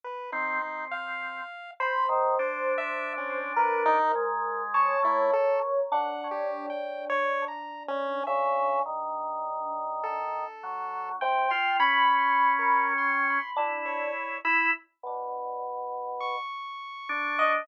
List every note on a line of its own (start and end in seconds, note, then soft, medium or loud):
0.04 0.31 B4 medium
0.32 0.59 C4 loud
0.32 0.85 D#4 medium
0.62 1.41 C4 medium
0.91 1.71 F5 medium
1.80 3.39 C5 medium
1.80 2.07 B5 medium
2.09 2.35 D#3 medium
2.39 3.98 D4 medium
2.39 2.74 C5 soft
2.78 3.13 E5 loud
3.17 3.53 C#4 medium
3.56 4.62 A#4 medium
3.56 3.83 B4 medium
3.86 4.12 D#4 loud
4.15 4.95 G#3 medium
4.74 5.80 C#5 medium
4.74 5.00 A5 medium
5.03 5.29 A3 medium
5.03 5.31 E4 medium
5.33 5.60 A4 medium
5.92 10.15 D4 medium
5.92 6.28 F#5 medium
6.31 6.66 G4 medium
6.70 7.05 G5 medium
7.10 7.45 C#5 loud
7.48 7.83 A#5 soft
7.88 8.23 C#4 loud
8.27 8.80 C#3 loud
8.27 8.80 E5 medium
8.86 10.44 D#3 medium
10.03 11.09 A4 medium
10.63 11.16 F#3 medium
11.21 11.48 C3 loud
11.21 11.74 G5 medium
11.50 11.77 F4 medium
11.50 11.77 C6 medium
11.79 13.38 C#4 loud
11.79 12.15 B5 medium
11.79 12.86 B5 medium
12.18 12.53 C6 medium
12.59 12.94 A#4 medium
12.98 13.51 C6 medium
13.56 14.09 D4 medium
13.56 14.37 E4 soft
13.85 14.38 C#5 medium
14.45 14.71 E4 loud
14.45 14.71 B5 medium
15.03 16.36 B2 medium
16.20 17.53 C#6 medium
17.09 17.62 D4 loud
17.39 17.65 D#5 medium